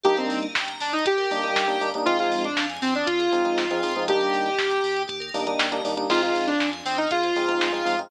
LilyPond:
<<
  \new Staff \with { instrumentName = "Lead 2 (sawtooth)" } { \time 4/4 \key f \dorian \tempo 4 = 119 g'16 c'8 r8. d'16 ees'16 g'2 | f'16 f'8 d'8 r16 c'16 d'16 f'2 | g'2 r2 | f'16 f'8 d'8 r16 c'16 ees'16 f'2 | }
  \new Staff \with { instrumentName = "Electric Piano 1" } { \time 4/4 \key f \dorian <g bes d' ees'>2~ <g bes d' ees'>8 <g bes d' ees'>16 <g bes d' ees'>8 <g bes d' ees'>16 <g bes d' ees'>16 <g bes d' ees'>16 | <f aes c' ees'>2~ <f aes c' ees'>8 <f aes c' ees'>16 <f aes c' ees'>8 <f aes c' ees'>16 <f aes c' ees'>16 <f aes c' ees'>16 | <g bes d' ees'>2~ <g bes d' ees'>8 <g bes d' ees'>16 <g bes d' ees'>8 <g bes d' ees'>16 <g bes d' ees'>16 <g bes d' ees'>16 | <aes c' ees' f'>2~ <aes c' ees' f'>8 <aes c' ees' f'>16 <aes c' ees' f'>8 <aes c' ees' f'>16 <aes c' ees' f'>16 <aes c' ees' f'>16 | }
  \new Staff \with { instrumentName = "Tubular Bells" } { \time 4/4 \key f \dorian g'16 bes'16 d''16 ees''16 g''16 bes''16 d'''16 ees'''16 g'16 bes'16 d''16 ees''16 g''16 bes''16 d'''16 ees'''16 | f'16 aes'16 c''16 ees''16 f''16 aes''16 c'''16 ees'''16 f'16 aes'16 c''16 ees''16 f''16 aes''16 c'''16 ees'''16 | g'16 bes'16 d''16 ees''16 g''16 bes''16 d'''16 ees'''16 g'16 bes'16 d''16 ees''16 g''16 bes''16 d'''16 ees'''16 | aes'16 c''16 ees''16 f''16 aes''16 c'''16 ees'''16 f'''16 aes'16 c''16 ees''16 f''16 aes''16 c'''16 ees'''16 f'''16 | }
  \new Staff \with { instrumentName = "Synth Bass 2" } { \clef bass \time 4/4 \key f \dorian g,,8 g,,8 g,,8 g,,8 g,,8 g,,8 g,,8 g,,8 | f,8 f,8 f,8 f,8 f,8 f,8 f,8 f,8 | ees,8 ees,8 ees,8 ees,8 ees,8 ees,8 ees,8 ees,8 | f,8 f,8 f,8 f,8 f,8 f,8 f,8 f,8 | }
  \new DrumStaff \with { instrumentName = "Drums" } \drummode { \time 4/4 <hh bd>16 hh16 hho16 hh16 <bd sn>16 hh16 hho16 hh16 <hh bd>16 hh16 hho16 hh16 <bd sn>16 hh16 hho16 hh16 | <hh bd>16 hh16 hho16 hh16 <bd sn>16 hh16 hho16 hh16 <hh bd>16 hh16 hho16 hh16 <bd sn>16 hh16 hho16 hh16 | <hh bd>16 hh16 hho16 hh16 <bd sn>16 hh16 hho16 hh16 <hh bd>16 hh16 hho16 hh16 <bd sn>16 hh16 hho16 hh16 | <cymc bd>16 hh16 hho16 hh16 <bd sn>16 hh16 hho16 hh16 <hh bd>16 hh16 hho16 hh16 <bd sn>16 hh16 hho16 hh16 | }
>>